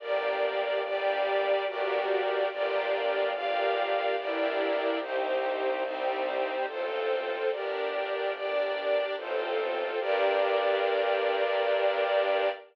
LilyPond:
<<
  \new Staff \with { instrumentName = "String Ensemble 1" } { \time 3/4 \key g \minor \tempo 4 = 72 <bes d' g'>4 <g bes g'>4 <bes d' fis' g'>4 | <bes d' f' g'>4 <bes d' g' bes'>4 <bes d' e' g'>4 | <c' ees' g'>4 <g c' g'>4 <c' f' a'>4 | <d' g' bes'>4 <d' bes' d''>4 <c' f' a'>4 |
<bes d' g'>2. | }
  \new Staff \with { instrumentName = "String Ensemble 1" } { \time 3/4 \key g \minor <g' bes' d''>4 <d' g' d''>4 <fis' g' bes' d''>4 | <f' g' bes' d''>4 <f' g' d'' f''>4 <e' g' bes' d''>4 | <ees' g' c''>4 <c' ees' c''>4 <f' a' c''>4 | <g' bes' d''>4 <d' g' d''>4 <f' a' c''>4 |
<g' bes' d''>2. | }
  \new Staff \with { instrumentName = "Violin" } { \clef bass \time 3/4 \key g \minor g,,2 g,,4 | g,,2 g,,4 | c,2 a,,4 | g,,2 a,,4 |
g,2. | }
>>